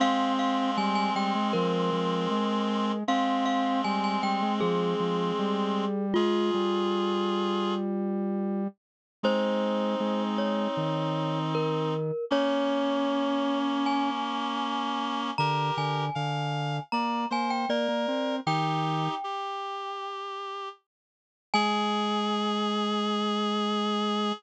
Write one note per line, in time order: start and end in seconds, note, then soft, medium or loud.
0.00 2.92 G#3 medium
0.00 0.71 C4 loud
0.00 2.92 C4 medium
0.00 0.33 F5 medium
0.39 0.76 F5 medium
0.77 1.10 G3 loud
0.77 0.95 G#5 medium
0.95 1.14 G#5 medium
1.15 1.33 G3 medium
1.15 1.52 G5 medium
1.35 1.53 G#3 medium
1.53 1.90 F3 loud
1.53 2.98 A#4 medium
1.92 2.27 F3 medium
2.31 3.04 G#3 medium
3.08 5.85 G#3 medium
3.08 5.85 C4 medium
3.08 3.82 C4 loud
3.08 3.45 F5 medium
3.46 3.81 F5 medium
3.84 4.19 G3 medium
3.84 4.03 G#5 medium
4.04 4.22 G#5 medium
4.23 4.41 G3 medium
4.23 4.54 G5 medium
4.42 4.60 G#3 medium
4.61 4.94 F3 loud
4.61 6.05 G#4 medium
5.00 5.32 F3 medium
5.39 6.14 G3 loud
6.14 6.51 G#3 loud
6.14 8.63 F4 medium
6.14 7.74 F4 medium
6.14 7.74 G#4 medium
6.54 8.67 G3 medium
9.23 9.95 G#3 loud
9.23 11.94 C4 medium
9.23 11.94 D#4 medium
9.23 10.24 C5 medium
10.00 10.68 G#3 loud
10.38 11.39 C#5 medium
10.77 12.12 D#3 medium
11.55 12.25 A#4 medium
12.30 15.31 A#3 medium
12.30 15.31 C#4 medium
12.30 14.10 C#4 loud
12.30 13.59 C#5 medium
13.86 15.36 G#5 medium
15.38 15.71 D3 medium
15.38 16.05 G4 medium
15.38 16.05 A#4 medium
15.38 15.74 A#5 medium
15.77 16.10 D3 medium
15.77 16.83 G#5 medium
16.15 16.80 D3 medium
16.15 16.77 F5 medium
16.92 17.26 A#3 medium
16.92 17.24 D5 medium
16.92 17.28 A#5 medium
17.30 17.66 A#3 medium
17.30 17.65 C5 medium
17.30 17.51 G#5 medium
17.50 17.69 G5 medium
17.69 17.87 A#3 medium
17.69 18.36 A#4 medium
17.69 18.36 D5 medium
17.88 18.07 A#3 medium
18.08 18.40 C4 medium
18.46 19.08 D#3 medium
18.46 19.15 D#4 medium
18.46 19.15 G4 medium
18.46 20.17 G5 medium
19.24 20.69 G4 medium
21.54 24.32 G#3 loud
21.54 24.33 G#4 loud
21.54 24.32 G#5 loud